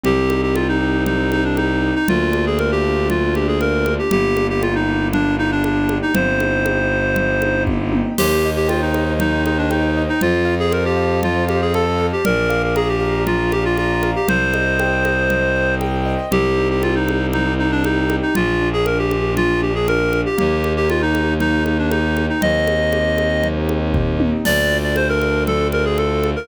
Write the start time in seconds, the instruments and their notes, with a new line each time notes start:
0.03 violin C2, acoustic grand piano C4, clarinet G4, low conga
0.30 acoustic grand piano D#4, high conga
0.43 clarinet G4
0.55 clarinet F4, acoustic grand piano G4, high conga
0.68 clarinet D#4
0.82 acoustic grand piano D#4
1.06 acoustic grand piano C4, clarinet D#4, low conga
1.32 clarinet D#4, acoustic grand piano D#4, high conga
1.44 clarinet D4
1.57 clarinet D#4, acoustic grand piano G4, high conga
1.82 acoustic grand piano D#4
1.95 clarinet D#4
2.08 violin D2, acoustic grand piano A#3, clarinet F4, low conga
2.32 acoustic grand piano D4, high conga
2.46 clarinet G#4
2.59 acoustic grand piano F4, clarinet A#4, high conga
2.72 clarinet G4
2.83 acoustic grand piano D4
3.09 acoustic grand piano A#3, clarinet F4, low conga
3.35 acoustic grand piano D4, clarinet G4, high conga
3.48 clarinet G#4
3.60 acoustic grand piano F4, clarinet A#4, high conga
3.85 acoustic grand piano D4, high conga
3.99 clarinet G4
4.11 violin G1, acoustic grand piano A#3, clarinet G4, low conga
4.37 acoustic grand piano D4, high conga
4.50 clarinet G4
4.61 clarinet F4, acoustic grand piano G4, high conga
4.75 clarinet D#4
4.88 acoustic grand piano D4
5.13 acoustic grand piano A#3, clarinet D4, low conga
5.37 acoustic grand piano D4, clarinet D#4
5.51 clarinet D4
5.64 clarinet D4, acoustic grand piano G4, high conga
5.89 acoustic grand piano D4, high conga
6.02 clarinet D#4
6.13 violin G1, acoustic grand piano C4, clarinet C5, low conga
6.40 acoustic grand piano D#4, high conga
6.66 acoustic grand piano G4, high conga
6.92 acoustic grand piano D#4
7.15 acoustic grand piano C4, low conga
7.42 acoustic grand piano D#4, high conga
7.66 acoustic grand piano G4, kick, high tom
7.92 acoustic grand piano D#4, high tom
8.18 violin D#2, clarinet G4, acoustic grand piano C5, crash, low conga
8.46 acoustic grand piano D#5
8.56 clarinet G4
8.68 clarinet F4, acoustic grand piano G5, high conga
8.82 clarinet D#4
8.94 acoustic grand piano D#5, high conga
9.19 clarinet D#4, acoustic grand piano C5, low conga
9.45 clarinet D#4, acoustic grand piano D#5, high conga
9.58 clarinet D4
9.71 clarinet D#4, acoustic grand piano G5, high conga
9.97 acoustic grand piano D#5
10.09 clarinet D#4
10.21 violin F2, clarinet F4, acoustic grand piano C5, low conga
10.45 acoustic grand piano F5
10.60 clarinet G#4
10.72 clarinet A#4, acoustic grand piano A5, high conga
10.85 clarinet G4
10.97 acoustic grand piano F5
11.23 clarinet F4, acoustic grand piano C5, low conga
11.48 clarinet G4, acoustic grand piano F5, high conga
11.61 clarinet G#4
11.74 clarinet A4, acoustic grand piano A5, high conga
11.98 acoustic grand piano F5
12.13 clarinet G4
12.25 violin A#1, clarinet A#4, acoustic grand piano D5, low conga
12.50 acoustic grand piano F5, high conga
12.63 clarinet A#4
12.76 clarinet G#4, acoustic grand piano A#5, high conga
12.89 clarinet G4
13.00 acoustic grand piano F5
13.27 clarinet F4, acoustic grand piano D5, low conga
13.51 clarinet G4, acoustic grand piano F5, high conga
13.65 clarinet F4
13.77 clarinet F4, acoustic grand piano A#5, high conga
14.03 acoustic grand piano F5, high conga
14.16 clarinet G4
14.27 violin C2, clarinet C5, acoustic grand piano C5, low conga
14.54 acoustic grand piano D#5, high conga
14.79 acoustic grand piano G5, high conga
15.05 acoustic grand piano D#5, high conga
15.29 acoustic grand piano C5, low conga
15.56 acoustic grand piano D#5
15.81 acoustic grand piano G5, high conga
16.05 acoustic grand piano D#5
16.31 violin C2, acoustic grand piano C4, clarinet G4, low conga
16.58 acoustic grand piano D#4
16.70 clarinet G4
16.81 clarinet F4, acoustic grand piano G4, high conga
16.95 clarinet D#4
17.08 acoustic grand piano D#4, high conga
17.33 acoustic grand piano C4, clarinet D#4, low conga
17.58 acoustic grand piano D#4, clarinet D#4
17.72 clarinet D4
17.84 clarinet D#4, acoustic grand piano G4, high conga
18.10 acoustic grand piano D#4, high conga
18.22 clarinet D#4
18.35 violin A#1, acoustic grand piano A#3, clarinet F4, low conga
18.61 acoustic grand piano D4
18.73 clarinet G#4
18.86 acoustic grand piano F4, clarinet A#4, high conga
18.99 clarinet G4
19.11 acoustic grand piano D4, high conga
19.36 acoustic grand piano A#3, clarinet F4, low conga
19.62 acoustic grand piano D4, clarinet G4
19.75 clarinet G#4
19.87 acoustic grand piano F4, clarinet A#4, high conga
20.12 acoustic grand piano D4, high conga
20.26 clarinet G4
20.38 violin D#2, acoustic grand piano A#3, clarinet G4, low conga
20.64 acoustic grand piano D#4, high conga
20.77 clarinet G4
20.90 clarinet F4, acoustic grand piano G4, high conga
21.02 clarinet D#4
21.14 acoustic grand piano D#4, high conga
21.40 acoustic grand piano A#3, clarinet D#4, low conga
21.64 acoustic grand piano D#4, clarinet D#4, high conga
21.78 clarinet D4
21.91 clarinet D#4, acoustic grand piano G4, high conga
22.17 acoustic grand piano D#4, high conga
22.29 clarinet D#4
22.41 violin D#2, acoustic grand piano C4, clarinet D#5, low conga
22.67 acoustic grand piano D#4, high conga
22.92 acoustic grand piano G4, high conga
23.17 acoustic grand piano D#4, high conga
23.44 acoustic grand piano C4, low conga
23.69 acoustic grand piano D#4, high conga
23.94 acoustic grand piano G4, kick, floor tom
24.20 acoustic grand piano D#4, high tom
24.45 violin D2, acoustic grand piano D4, clarinet D5, crash, low conga
24.72 acoustic grand piano F4
24.83 clarinet D5
24.96 acoustic grand piano A4, clarinet C5, high conga
25.09 clarinet A#4
25.22 acoustic grand piano F4, high conga
25.47 acoustic grand piano D4, clarinet A4, low conga
25.72 acoustic grand piano F4, clarinet A#4, high conga
25.85 clarinet G#4
25.97 acoustic grand piano A4, clarinet A4, high conga
26.24 acoustic grand piano F4, high conga
26.36 clarinet A#4